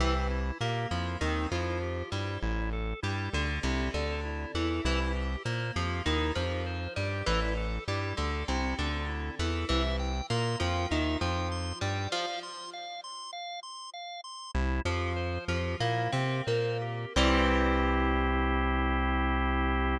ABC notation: X:1
M:4/4
L:1/16
Q:1/4=99
K:Cmix
V:1 name="Acoustic Guitar (steel)"
E, z3 B,2 F,2 _E,2 F,4 G,2 | z4 G,2 D,2 C,2 D,4 E,2 | E, z3 B,2 F,2 _E,2 F,4 G,2 | E, z3 G,2 D,2 C,2 D,4 E,2 |
E, z3 B,2 F,2 _E,2 F,4 G,2 | F, z15 | "^rit." z2 F,4 F,2 B,2 C2 B,4 | [E,G,C]16 |]
V:2 name="Drawbar Organ"
C2 E2 G2 E2 C2 E2 G2 E2 | E2 A2 E2 A2 E2 A2 E2 A2 | E2 G2 c2 G2 E2 G2 c2 G2 | E2 A2 E2 A2 E2 A2 E2 A2 |
e2 g2 c'2 g2 e2 g2 c'2 g2 | f2 c'2 f2 c'2 f2 c'2 f2 c'2 | "^rit." E2 G2 c2 G2 E2 G2 c2 G2 | [CEG]16 |]
V:3 name="Synth Bass 1" clef=bass
C,,4 B,,2 F,,2 _E,,2 F,,4 G,,2 | A,,,4 G,,2 D,,2 C,,2 D,,4 E,,2 | C,,4 B,,2 F,,2 _E,,2 F,,4 G,,2 | A,,,4 G,,2 D,,2 C,,2 D,,4 E,,2 |
C,,4 B,,2 F,,2 _E,,2 F,,4 G,,2 | z16 | "^rit." C,,2 F,,4 F,,2 B,,2 C,2 B,,4 | C,,16 |]